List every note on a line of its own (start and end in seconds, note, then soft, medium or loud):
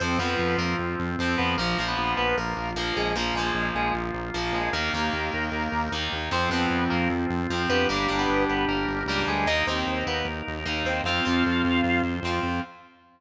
0.00 0.17 F2 loud
0.00 0.19 F3 medium
0.00 0.17 C4 medium
0.00 1.42 C4 loud
0.00 0.19 C4 medium
0.00 1.42 F4 loud
0.00 0.17 C5 medium
0.19 0.35 F2 medium
0.19 1.11 F3 medium
0.19 0.56 B3 medium
0.19 1.11 C4 medium
0.19 0.56 B4 medium
0.39 0.56 F2 medium
0.58 0.74 F2 medium
0.58 0.76 A#3 medium
0.58 0.76 A#4 medium
0.79 0.96 F2 medium
0.99 1.16 F2 medium
1.19 1.36 F2 medium
1.19 1.56 F3 medium
1.19 1.56 C4 medium
1.38 1.56 F2 loud
1.38 1.54 B3 medium
1.38 1.54 B4 medium
1.58 1.74 A#1 loud
1.58 1.77 F3 medium
1.58 1.85 A#3 medium
1.58 3.00 A#3 loud
1.58 1.77 A#3 medium
1.58 3.00 F4 loud
1.58 1.85 A#4 medium
1.78 1.95 A#1 medium
1.78 2.69 F3 medium
1.78 2.69 A#3 medium
1.88 2.14 B3 medium
1.88 2.14 B4 medium
1.97 2.14 A#1 medium
2.17 2.34 A#1 medium
2.17 2.36 B3 medium
2.17 2.36 B4 medium
2.37 2.54 A#1 medium
2.37 2.71 A#3 medium
2.37 2.71 A#4 medium
2.57 2.74 A#1 medium
2.75 2.92 A#1 medium
2.75 3.13 F3 medium
2.75 2.94 A#3 medium
2.75 3.13 A#3 medium
2.75 2.94 A#4 medium
2.96 3.14 A#1 medium
2.96 3.15 G#3 medium
2.96 3.15 G#4 medium
3.15 3.32 A#1 loud
3.15 3.34 F3 medium
3.15 3.35 A#3 medium
3.15 4.59 A#3 loud
3.15 3.34 A#3 medium
3.15 4.59 F4 loud
3.15 3.35 A#4 medium
3.34 3.51 A#1 medium
3.34 4.28 F3 medium
3.34 3.66 G#3 medium
3.34 3.66 G#4 medium
3.39 4.28 A#3 medium
3.54 3.71 A#1 medium
3.75 3.91 A#1 medium
3.75 3.93 G#3 medium
3.75 3.93 G#4 medium
3.94 4.11 A#1 loud
4.14 4.31 A#1 medium
4.34 4.51 A#1 medium
4.34 4.71 F3 medium
4.34 4.71 A#3 medium
4.53 4.69 A#1 medium
4.53 4.71 G#3 medium
4.53 4.71 G#4 medium
4.73 4.89 D#2 loud
4.73 4.92 D#3 loud
4.73 5.91 A#3 medium
4.73 6.15 A#3 loud
4.73 4.92 A#3 medium
4.73 6.15 D#4 loud
4.73 5.91 A#4 medium
4.93 5.10 D#2 medium
4.93 5.85 D#3 medium
4.93 5.85 A#3 medium
5.13 5.30 D#2 medium
5.33 5.50 D#2 medium
5.52 5.68 D#2 medium
5.72 5.89 D#2 loud
5.92 6.08 D#2 medium
5.92 6.29 D#3 medium
5.92 6.29 A#3 medium
6.12 6.29 D#2 medium
6.31 6.48 F2 loud
6.31 6.49 F3 medium
6.31 7.62 C4 loud
6.31 6.50 C4 medium
6.31 6.49 C4 medium
6.31 7.62 F4 loud
6.31 6.50 C5 medium
6.50 6.66 F2 medium
6.50 7.42 F3 medium
6.50 6.85 B3 medium
6.50 7.42 C4 medium
6.50 6.85 B4 medium
6.70 6.87 F2 medium
6.90 7.08 F2 medium
6.90 7.09 A#3 medium
6.90 7.09 A#4 medium
7.09 7.26 F2 medium
7.30 7.47 F2 loud
7.50 7.66 F2 medium
7.50 7.87 F3 medium
7.50 7.87 C4 medium
7.69 7.86 F2 medium
7.69 7.88 B3 medium
7.69 9.31 D4 loud
7.69 9.31 G4 loud
7.69 7.88 B4 medium
7.89 8.06 G1 loud
7.89 8.08 G3 medium
7.89 8.17 A#3 medium
7.89 8.08 D4 medium
7.89 8.17 A#4 medium
8.08 8.26 G1 medium
8.08 8.99 G3 medium
8.08 8.99 D4 medium
8.19 8.44 B3 medium
8.19 8.44 B4 medium
8.28 8.45 G1 medium
8.49 8.65 G1 medium
8.49 8.65 B3 medium
8.49 8.65 B4 medium
8.68 8.85 G1 medium
8.68 9.04 A#3 medium
8.68 9.04 A#4 medium
8.87 9.04 G1 medium
9.06 9.24 C#2 medium
9.06 9.46 G3 medium
9.06 9.25 A#3 medium
9.06 9.25 A#4 medium
9.11 9.46 D4 medium
9.27 9.45 D2 medium
9.27 9.46 G#3 medium
9.27 9.46 G#4 medium
9.46 9.63 D#2 loud
9.46 9.65 A#3 medium
9.46 9.66 D#4 medium
9.46 10.90 D#4 loud
9.46 9.65 D#4 medium
9.46 10.90 A#4 loud
9.46 9.66 D#5 medium
9.67 9.84 D#2 medium
9.67 10.59 A#3 medium
9.67 10.04 C4 medium
9.67 10.59 D#4 medium
9.67 10.04 C5 medium
9.87 10.03 D#2 medium
10.06 10.23 D#2 medium
10.06 10.26 B3 medium
10.06 10.26 B4 medium
10.25 10.42 D#2 medium
10.48 10.64 D#2 medium
10.66 10.83 D#2 medium
10.66 11.02 A#3 medium
10.66 11.02 D#4 medium
10.84 11.01 D#2 loud
10.84 11.02 C4 medium
10.84 11.02 C5 medium
11.03 11.20 F2 loud
11.03 11.24 C4 medium
11.03 12.47 F4 loud
11.03 12.02 F4 medium
11.03 12.47 C5 loud
11.03 12.02 F5 medium
11.08 11.24 F4 loud
11.25 11.43 F2 medium
11.25 12.16 C4 medium
11.25 12.16 F4 medium
11.46 11.63 F2 medium
11.65 11.81 F2 loud
11.84 12.01 F2 loud
12.03 12.20 F2 medium
12.23 12.39 F2 medium
12.23 12.61 C4 medium
12.27 12.61 F4 medium
12.43 12.60 F2 medium